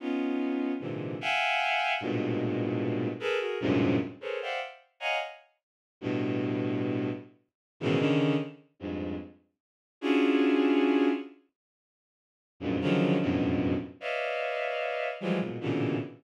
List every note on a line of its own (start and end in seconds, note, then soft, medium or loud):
0.00 0.72 B3 medium
0.00 0.72 C#4 medium
0.00 0.72 D#4 medium
0.00 0.72 F4 medium
0.80 1.16 G#2 medium
0.80 1.16 A#2 medium
0.80 1.16 C3 medium
0.80 1.16 D3 medium
0.80 1.16 E3 medium
1.21 1.93 E5 medium
1.21 1.93 F5 medium
1.21 1.93 F#5 medium
1.21 1.93 G5 medium
1.21 1.93 G#5 medium
2.01 3.09 G2 medium
2.01 3.09 G#2 medium
2.01 3.09 A2 medium
2.01 3.09 A#2 medium
2.01 3.09 B2 medium
3.20 3.38 G#4 medium
3.20 3.38 A4 medium
3.20 3.38 A#4 medium
3.20 3.38 B4 medium
3.40 3.58 F#4 medium
3.40 3.58 G#4 medium
3.40 3.58 A#4 medium
3.60 3.96 F#2 medium
3.60 3.96 G2 medium
3.60 3.96 G#2 medium
3.60 3.96 A2 medium
3.60 3.96 A#2 medium
3.60 3.96 C3 medium
4.21 4.39 G#4 medium
4.21 4.39 A4 medium
4.21 4.39 A#4 medium
4.21 4.39 B4 medium
4.21 4.39 C5 medium
4.21 4.39 C#5 medium
4.42 4.60 C5 medium
4.42 4.60 D5 medium
4.42 4.60 E5 medium
4.42 4.60 F5 medium
4.42 4.60 F#5 medium
4.42 4.60 G5 medium
5.00 5.18 C#5 medium
5.00 5.18 D#5 medium
5.00 5.18 F5 medium
5.00 5.18 F#5 medium
5.00 5.18 G#5 medium
5.00 5.18 A#5 medium
6.01 7.09 G2 medium
6.01 7.09 A2 medium
6.01 7.09 B2 medium
7.80 7.98 G#2 loud
7.80 7.98 A2 loud
7.80 7.98 B2 loud
7.80 7.98 C#3 loud
7.80 7.98 D#3 loud
7.80 7.98 E3 loud
7.99 8.35 C#3 loud
7.99 8.35 D3 loud
7.99 8.35 D#3 loud
8.79 9.16 F2 medium
8.79 9.16 G2 medium
8.79 9.16 G#2 medium
10.01 11.09 C#4 medium
10.01 11.09 D4 medium
10.01 11.09 E4 medium
10.01 11.09 F4 medium
10.01 11.09 F#4 medium
10.01 11.09 G#4 medium
12.60 12.78 F2 medium
12.60 12.78 F#2 medium
12.60 12.78 G2 medium
12.60 12.78 G#2 medium
12.60 12.78 A#2 medium
12.81 13.17 C#3 medium
12.81 13.17 D3 medium
12.81 13.17 D#3 medium
12.81 13.17 F3 medium
12.81 13.17 F#3 medium
13.20 13.74 F2 medium
13.20 13.74 F#2 medium
13.20 13.74 G2 medium
13.20 13.74 A2 medium
13.20 13.74 B2 medium
14.01 15.09 B4 medium
14.01 15.09 C#5 medium
14.01 15.09 D5 medium
14.01 15.09 D#5 medium
14.01 15.09 E5 medium
14.01 15.09 F5 medium
15.20 15.38 E3 medium
15.20 15.38 F3 medium
15.20 15.38 F#3 medium
15.20 15.38 G3 medium
15.20 15.38 G#3 medium
15.39 15.57 G#2 soft
15.39 15.57 A#2 soft
15.39 15.57 B2 soft
15.61 15.97 A2 medium
15.61 15.97 A#2 medium
15.61 15.97 B2 medium
15.61 15.97 C#3 medium
15.61 15.97 D3 medium
15.61 15.97 E3 medium